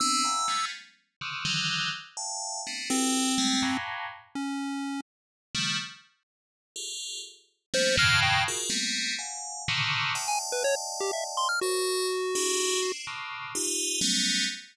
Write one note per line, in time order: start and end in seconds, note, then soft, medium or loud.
0.00 0.22 B3 loud
0.00 0.22 C4 loud
0.00 0.22 D4 loud
0.00 0.65 E6 medium
0.24 0.46 E5 medium
0.24 0.46 F5 medium
0.24 0.46 F#5 medium
0.24 0.46 G#5 medium
0.24 0.46 A#5 medium
0.48 0.70 F3 medium
0.48 0.70 G3 medium
0.48 0.70 G#3 medium
0.48 0.70 A3 medium
0.48 0.70 B3 medium
0.48 0.70 C#4 medium
1.21 1.43 C3 medium
1.21 1.43 C#3 medium
1.21 1.43 D3 medium
1.21 1.43 D#3 medium
1.45 1.89 D3 loud
1.45 1.89 D#3 loud
1.45 1.89 E3 loud
1.45 1.89 F#3 loud
2.17 2.60 E5 medium
2.17 2.60 F5 medium
2.17 2.60 G5 medium
2.17 2.60 A5 medium
2.67 2.89 A3 medium
2.67 2.89 B3 medium
2.67 2.89 C4 medium
2.67 2.89 D4 medium
2.90 3.77 C4 medium
2.90 3.33 E4 medium
2.90 3.33 F#4 medium
2.90 3.33 G4 medium
2.90 3.33 A4 medium
2.90 3.33 B4 medium
3.38 3.60 G3 loud
3.38 3.60 G#3 loud
3.38 3.60 A3 loud
3.62 4.06 F2 medium
3.62 4.06 G2 medium
3.62 4.06 A2 medium
3.62 4.06 A#2 medium
4.35 5.01 C#4 medium
5.55 5.76 C#3 medium
5.55 5.76 D#3 medium
5.55 5.76 F3 medium
5.55 5.76 G3 medium
5.55 5.76 A3 medium
6.76 7.19 F4 medium
6.76 7.19 G4 medium
6.76 7.19 G#4 medium
6.76 7.19 A4 medium
7.74 7.95 F3 medium
7.74 7.95 G3 medium
7.74 7.95 A3 medium
7.74 7.95 A#3 medium
7.74 7.95 B3 medium
7.74 7.95 C#4 medium
7.74 7.96 C5 loud
7.97 8.41 F2 loud
7.97 8.41 G2 loud
7.97 8.41 A2 loud
7.97 8.41 B2 loud
7.97 8.41 C#3 loud
7.97 8.41 D#3 loud
7.97 8.20 F6 loud
8.22 8.44 G5 medium
8.48 8.70 F4 medium
8.48 8.70 F#4 medium
8.48 8.70 G#4 medium
8.48 8.70 A#4 medium
8.70 9.13 G3 medium
8.70 9.13 A3 medium
8.70 9.13 A#3 medium
8.70 9.13 B3 medium
8.70 9.13 C4 medium
9.19 9.62 F5 medium
9.19 9.62 F#5 medium
9.19 9.62 G#5 medium
9.68 10.12 A2 medium
9.68 10.12 A#2 medium
9.68 10.12 C3 medium
9.68 10.12 C#3 medium
9.68 10.12 D3 medium
9.68 10.12 D#3 medium
10.15 11.46 D5 medium
10.15 11.46 D#5 medium
10.15 11.46 F5 medium
10.15 11.46 G5 medium
10.15 11.46 A5 medium
10.28 10.39 G#5 medium
10.52 10.63 B4 medium
10.64 10.75 C#5 loud
11.00 11.11 G4 medium
11.13 11.24 E5 medium
11.37 11.48 C6 loud
11.49 11.60 F6 medium
11.61 12.92 F#4 medium
11.61 12.06 A#4 medium
11.61 12.06 C5 medium
11.61 12.06 C#5 medium
12.35 12.79 D4 medium
12.35 12.79 E4 medium
12.35 12.79 F#4 medium
12.35 12.79 G4 medium
12.35 12.79 G#4 medium
12.82 13.04 C4 medium
12.82 13.04 D4 medium
12.82 13.04 E4 medium
13.07 13.51 A2 medium
13.07 13.51 B2 medium
13.07 13.51 C#3 medium
13.07 13.51 D3 medium
13.55 13.99 D#4 loud
13.55 13.99 F4 loud
13.55 13.99 G4 loud
14.01 14.45 F#3 loud
14.01 14.45 G3 loud
14.01 14.45 A3 loud
14.01 14.45 B3 loud
14.01 14.45 C#4 loud